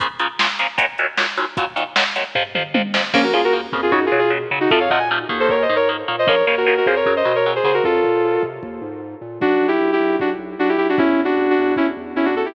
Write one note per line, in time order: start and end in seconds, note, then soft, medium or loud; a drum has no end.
0.00 0.07 A#2 medium
0.00 0.07 C#3 medium
0.00 0.07 F3 medium
0.00 kick loud
0.00 closed hi-hat medium
0.19 0.27 A#2 medium
0.19 0.27 C#3 medium
0.19 0.27 F3 medium
0.19 closed hi-hat medium
0.39 0.47 A#2 medium
0.39 0.47 C#3 medium
0.39 0.47 F3 medium
0.39 snare loud
0.59 0.67 A#2 medium
0.59 0.67 C#3 medium
0.59 0.67 F3 medium
0.59 closed hi-hat medium
0.78 0.86 D#2 medium
0.78 0.86 A#2 medium
0.78 0.86 F#3 medium
0.78 kick medium
0.78 closed hi-hat loud
0.98 1.07 D#2 medium
0.98 1.07 A#2 medium
0.98 1.07 F#3 medium
0.98 closed hi-hat medium
1.17 1.25 D#2 medium
1.17 1.25 A#2 medium
1.17 1.25 F#3 medium
1.17 snare loud
1.37 1.45 D#2 medium
1.37 1.45 A#2 medium
1.37 1.45 F#3 medium
1.37 closed hi-hat medium
1.57 1.65 D#2 medium
1.57 1.65 A#2 medium
1.57 1.65 F#3 loud
1.57 kick loud
1.57 closed hi-hat medium
1.76 1.84 D#2 medium
1.76 1.84 A#2 medium
1.76 1.84 F#3 medium
1.76 closed hi-hat medium
1.96 2.04 D#2 medium
1.96 2.04 A#2 medium
1.96 2.04 F#3 medium
1.96 snare loud
2.16 2.24 D#2 medium
2.16 2.24 A#2 medium
2.16 2.24 F#3 medium
2.16 closed hi-hat medium
2.35 2.43 F2 medium
2.35 2.43 C3 medium
2.35 2.43 F3 medium
2.35 kick medium
2.35 floor tom medium
2.55 2.63 F2 medium
2.55 2.63 C3 medium
2.55 2.63 F3 medium
2.55 mid tom medium
2.74 2.82 F2 medium
2.74 2.82 C3 medium
2.74 2.82 F3 medium
2.74 high tom medium
2.94 3.02 F2 medium
2.94 3.02 C3 medium
2.94 3.02 F3 medium
2.94 snare loud
3.14 3.31 A#1 medium
3.14 3.21 C#3 medium
3.14 3.21 F3 medium
3.14 3.21 A#3 medium
3.14 3.23 A#3 medium
3.14 3.23 C#4 medium
3.14 kick medium
3.14 crash medium
3.23 3.32 F#4 medium
3.23 3.32 A#4 medium
3.33 3.66 D#2 medium
3.33 3.41 C#3 medium
3.33 3.41 F3 medium
3.33 3.41 A#3 medium
3.33 3.42 F4 medium
3.33 3.42 G#4 medium
3.44 3.54 F#4 medium
3.44 3.54 A#4 medium
3.53 3.61 C#3 medium
3.53 3.61 F3 medium
3.53 3.61 A#3 medium
3.72 3.89 F2 medium
3.72 3.81 C#3 medium
3.72 3.81 F3 medium
3.72 3.81 A#3 medium
3.72 kick medium
3.82 3.92 F4 medium
3.82 3.92 G#4 medium
3.91 4.08 F#2 medium
3.91 4.00 C#3 loud
3.91 4.00 F#3 medium
3.91 4.04 D#4 medium
3.91 4.04 F#4 medium
3.91 kick medium
4.06 4.18 F4 medium
4.06 4.18 G#4 medium
4.12 4.45 B2 medium
4.12 4.20 C#3 medium
4.12 4.20 F#3 medium
4.19 4.31 F4 medium
4.19 4.31 G#4 medium
4.30 4.38 C#3 medium
4.30 4.38 F#3 medium
4.51 4.67 C#3 medium
4.51 4.59 C#3 medium
4.51 4.59 F#3 medium
4.60 4.70 D#4 medium
4.60 4.70 F#4 medium
4.70 4.88 F2 medium
4.70 4.79 C3 medium
4.70 4.79 F3 medium
4.70 4.79 A3 medium
4.70 4.80 F4 medium
4.70 4.80 A4 medium
4.70 kick loud
4.80 4.90 C#5 medium
4.80 4.90 F5 medium
4.90 5.25 A#2 medium
4.90 4.99 C3 medium
4.90 4.99 F3 medium
4.90 4.99 A3 medium
4.90 4.99 D#5 medium
4.90 4.99 F#5 medium
4.90 kick medium
4.99 5.08 G#5 medium
5.11 5.19 C3 medium
5.11 5.19 F3 medium
5.11 5.19 A3 medium
5.29 5.66 D#2 medium
5.29 5.57 D#3 medium
5.29 5.57 A#3 medium
5.29 kick medium
5.40 5.49 A4 medium
5.40 5.49 C5 medium
5.49 5.63 A#4 medium
5.49 5.63 C#5 medium
5.49 kick medium
5.62 5.74 C5 medium
5.62 5.74 D#5 medium
5.69 6.03 G#2 medium
5.69 5.77 D#3 medium
5.69 5.77 A#3 medium
5.76 5.88 A#4 medium
5.76 5.88 C#5 medium
5.89 5.97 D#3 medium
5.89 5.97 A#3 medium
6.08 6.25 A#2 medium
6.08 6.16 D#3 medium
6.08 6.16 A#3 medium
6.19 6.28 C5 medium
6.19 6.28 D#5 medium
6.26 6.43 A#1 medium
6.26 6.35 C#3 medium
6.26 6.35 F3 medium
6.26 6.35 A#3 medium
6.26 6.45 A#4 medium
6.26 6.45 C#5 medium
6.26 kick loud
6.46 6.80 D#2 medium
6.46 6.55 C#3 medium
6.46 6.55 F3 medium
6.46 6.55 A#3 medium
6.46 6.56 A#4 medium
6.46 6.56 C#5 medium
6.57 6.66 F#4 medium
6.57 6.66 A#4 medium
6.66 6.74 C#3 medium
6.66 6.74 F3 medium
6.66 6.74 A#3 medium
6.66 6.76 F#4 medium
6.66 6.76 A#4 medium
6.77 6.87 F#4 medium
6.77 6.87 A#4 medium
6.86 7.03 F2 medium
6.86 6.95 C#3 medium
6.86 6.95 F3 medium
6.86 6.95 A#3 medium
6.86 6.96 G#4 medium
6.86 6.96 C5 medium
6.86 kick medium
6.96 7.14 A#4 medium
6.96 7.14 C#5 medium
7.06 7.22 F#2 medium
7.06 7.14 C#3 medium
7.06 7.14 F#3 medium
7.06 kick medium
7.16 7.35 C5 medium
7.16 7.35 D#5 medium
7.25 7.59 B2 medium
7.25 7.33 C#3 medium
7.25 7.33 F#3 medium
7.35 7.51 A#4 medium
7.35 7.51 C#5 medium
7.46 7.54 C#3 medium
7.46 7.54 F#3 medium
7.55 7.64 G#4 medium
7.55 7.64 C5 medium
7.64 7.80 C#3 medium
7.64 7.72 C#3 medium
7.64 7.72 F#3 medium
7.64 7.74 G#4 medium
7.64 7.74 C5 medium
7.74 7.83 F#4 medium
7.74 7.83 A#4 medium
7.84 8.00 F2 medium
7.84 8.42 F4 medium
7.84 8.42 A4 medium
7.84 kick medium
8.04 8.37 A#2 medium
8.04 kick medium
8.42 8.59 C3 medium
8.42 kick medium
8.63 8.79 D#2 medium
8.63 kick medium
8.81 9.15 G#2 medium
9.21 9.38 A#2 medium
9.40 9.57 B1 medium
9.40 9.67 D4 medium
9.40 9.67 F#4 medium
9.40 kick medium
9.61 9.78 B1 medium
9.68 9.91 E4 medium
9.68 9.91 G4 medium
9.80 9.97 B1 medium
9.93 10.16 E4 medium
9.93 10.16 G4 medium
10.00 10.17 B1 medium
10.19 10.36 B1 medium
10.19 10.30 D4 medium
10.19 10.30 F#4 medium
10.19 kick medium
10.39 10.55 B1 medium
10.58 10.75 B1 medium
10.58 10.68 D4 medium
10.58 10.68 F#4 medium
10.69 10.77 E4 medium
10.69 10.77 G4 medium
10.78 10.95 B1 medium
10.78 10.87 E4 medium
10.78 10.87 G4 medium
10.89 10.98 D4 medium
10.89 10.98 F#4 medium
10.98 11.15 E2 medium
10.98 11.20 C#4 medium
10.98 11.20 E4 medium
10.98 kick loud
11.19 11.35 E2 medium
11.25 11.50 D4 medium
11.25 11.50 F#4 medium
11.38 11.54 E2 medium
11.50 11.74 D4 medium
11.50 11.74 F#4 medium
11.58 11.75 E2 medium
11.76 11.94 E2 medium
11.76 11.86 C#4 medium
11.76 11.86 E4 medium
11.76 kick medium
11.97 12.13 E2 medium
12.16 12.33 E2 medium
12.16 12.25 C#4 medium
12.16 12.25 E4 medium
12.25 12.34 D4 medium
12.25 12.34 F#4 medium
12.35 12.52 E2 medium
12.35 12.46 F#4 medium
12.35 12.46 A4 medium
12.45 12.54 E4 medium
12.45 12.54 G4 medium